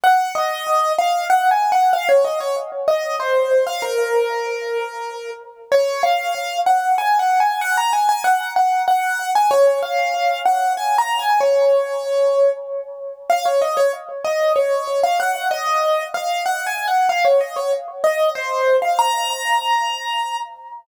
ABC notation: X:1
M:3/4
L:1/16
Q:1/4=95
K:Bbm
V:1 name="Acoustic Grand Piano"
g2 e4 f2 (3g2 a2 g2 | f d e d z2 e2 c3 f | B10 z2 | [K:Db] d2 f4 g2 (3a2 g2 a2 |
g b a a g2 g2 g3 a | d2 f4 g2 (3a2 b2 a2 | d8 z4 | [K:Bbm] f d e d z2 e2 d3 f |
g2 e4 f2 (3g2 a2 g2 | f d e d z2 e2 c3 f | b10 z2 |]